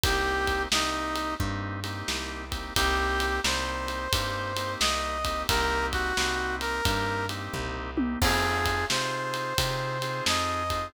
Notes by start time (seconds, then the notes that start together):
0.04 C2 A#3 C4 D#4 G4, kick, ride
0.47 kick, ride
0.72 C2 A#3 C4 D#4 G4, snare
1.16 ride
1.39 G2 A#3 C4 D#4 G4, kick
1.84 A#3 C4 D#4 G4, ride
2.08 C2, snare
2.51 A#3 C4 D#4 G4, kick, ride
2.76 C2 A#3 C4 D#4 G4, kick, ride
3.20 ride
3.44 C2 A#3 C4 D#4 G4 C5, snare
3.88 ride
4.13 G2 A#3 C4 D#4 G4, kick, ride
4.57 A#3 C4 D#4 G4, ride
4.80 C2 D#5, snare
5.25 A#3 C4 D#4 G4, kick, ride
5.49 C2 A#3 C4 D#4 G4 A#4, kick, ride
5.92 F#4, kick, ride
6.17 C2 A#3 C4 D#4 G4, snare
6.61 A#4, ride
6.85 G2 A#3 C4 D#4 G4, kick, ride
7.29 A#3 C4 D#4 G4, ride
7.54 C2, kick, floor tom
7.97 A#3 C4 D#4 G4, high tom
8.21 F2 C4 D#4 F4 G#4, kick, crash
8.66 kick, ride
8.90 C3 C4 D#4 F4 G#4 C5, snare
9.34 ride
9.58 C3 C4 D#4 F4 G#4, kick, ride
10.02 C4 D#4 F4 G#4, ride
10.26 F2 D#5, snare
10.70 C4 D#4 F4 G#4, kick, ride